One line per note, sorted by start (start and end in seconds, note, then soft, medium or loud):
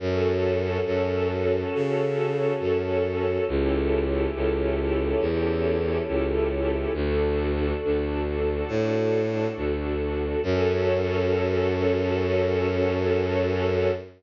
0.00 0.78 F#2 loud
0.00 3.44 C#4 medium
0.00 3.44 F#4 medium
0.00 3.44 A4 medium
0.86 1.64 F#2 medium
1.75 2.53 C#3 medium
2.60 3.38 F#2 medium
3.47 4.26 C#2 medium
3.47 6.92 C#4 medium
3.47 6.92 E4 medium
3.47 6.92 G4 medium
3.47 6.92 A4 medium
4.35 5.14 C#2 medium
5.20 5.99 E2 medium
6.08 6.86 C#2 medium
6.94 7.72 D2 loud
6.94 10.40 D4 medium
6.94 10.40 F#4 medium
6.94 10.40 A4 medium
7.84 8.63 D2 medium
8.68 9.47 A2 medium
9.57 10.35 D2 medium
10.43 13.90 F#2 loud
10.43 13.91 C#4 medium
10.43 13.91 F#4 loud
10.43 13.91 A4 loud